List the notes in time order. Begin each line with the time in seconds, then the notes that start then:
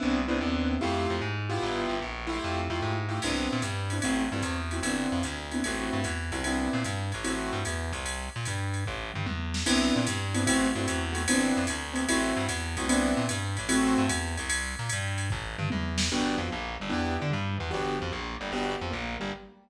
0.00 C2 B3 C4 D4 E4
0.28 C2 B3 C4 D4 E4
0.41 D#2 B3 C4 D4 E4
0.81 F2 A3 E4 F4 G4
1.10 F2
1.21 G#2
1.49 B3 E4 F4 G4
1.63 G1
1.89 G1
2.02 A#1
2.27 A3 E4 F4 G4
2.44 F2
2.70 F2 A3 E4 F4 G4
2.82 G#2
3.09 A3 E4 F4 G4
3.22 C2 B3 C4 D4 E4, crash, ride
3.53 A#2
3.62 G2, hi-hat pedal, ride
3.90 B3 C4 D4 E4, ride
4.02 A1 A3 C4 E4 F#4, kick, ride
4.32 G2 A3 C4 E4 F#4
4.42 E2, hi-hat pedal, ride
4.71 A3 C4 E4 F#4, ride
4.83 G1 B3 C4 D4 E4, ride
5.12 F2
5.23 D2, hi-hat pedal, ride
5.51 B3 C4 D4 E4, ride
5.64 A1 A3 C4 E4 F#4, ride
5.93 G2
6.04 E2, hi-hat pedal, ride
6.32 C2 A3 C4 E4 F#4, ride
6.44 B3 C4 D4 E4, ride
6.73 A#2
6.84 G2, hi-hat pedal, ride
7.12 A1, ride
7.24 A3 C4 E4 F#4, ride
7.53 G2
7.65 E2, hi-hat pedal, ride
7.93 C2, ride
8.06 ride
8.36 A#2
8.45 G2, hi-hat pedal, ride
8.74 ride
8.86 A1, kick
9.14 G2, mid tom
9.26 E2, high tom
9.54 snare
9.66 C2 B3 C4 D4 E4, crash, ride
9.96 A#2
10.07 G2, hi-hat pedal, ride
10.34 B3 C4 D4 E4, ride
10.47 A1 A3 C4 E4 F#4, kick, ride
10.75 G2 A3 C4 E4 F#4
10.88 E2, hi-hat pedal, ride
11.13 A3 C4 E4 F#4, ride
11.28 G1 B3 C4 D4 E4, ride
11.57 F2
11.67 D2, hi-hat pedal, ride
11.93 B3 C4 D4 E4, ride
12.09 A1 A3 C4 E4 F#4, ride
12.37 G2
12.49 E2, hi-hat pedal, ride
12.77 C2 A3 C4 E4 F#4, ride
12.89 B3 C4 D4 E4, ride
13.17 A#2
13.29 G2, hi-hat pedal, ride
13.57 A1, ride
13.69 A3 C4 E4 F#4, ride
13.98 G2
14.09 E2, hi-hat pedal, ride
14.37 C2, ride
14.50 ride
14.79 A#2
14.89 G2, hi-hat pedal, ride
15.18 ride
15.30 A1, kick
15.58 G2, mid tom
15.70 E2, high tom
15.98 snare
16.12 G1 B3 D4 F#4 G4
16.38 F2 F3
16.51 A#1 A#3
16.80 G1 G3
16.90 E2 B3 D4 E4 G4
17.20 D3 D4
17.31 G2 G3
17.58 E2 E3
17.71 G1 B3 D4 F#4 G4
17.99 F2 F3
18.12 A#1 A#3
18.40 G1 G3
18.52 G1 B3 D4 F#4 G4
18.81 F2 F3
18.91 A#1 A#3
19.20 G1 G3